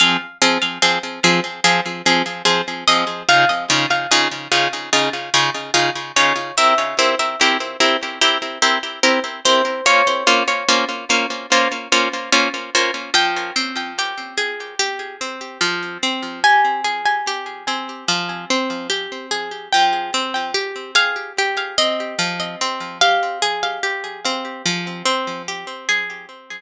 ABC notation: X:1
M:4/4
L:1/8
Q:1/4=73
K:Fm
V:1 name="Orchestral Harp"
f z6 e | f z6 d | =e z6 c | d4 z4 |
g8 | a8 | g3 f z e2 z | f4 z4 |]
V:2 name="Orchestral Harp"
[F,CA] [F,CA] [F,CA] [F,CA] [F,CA] [F,CA] [F,CA] [F,CA] | [D,EFA] [D,EFA] [D,EFA] [D,EFA] [D,EFA] [D,EFA] [D,EFA] [D,EFA] | [C=EGB] [CEGB] [CEGB] [CEGB] [CEGB] [CEGB] [CEGB] [CEGB] | [B,DFc] [B,DFc] [B,DFc] [B,DFc] [B,DFc] [B,DFc] [B,DFc] [B,DFc] |
F, C G A G C F, C | G A G C F, C G A | F, C G A G C F, C | G A G C F, C G A |]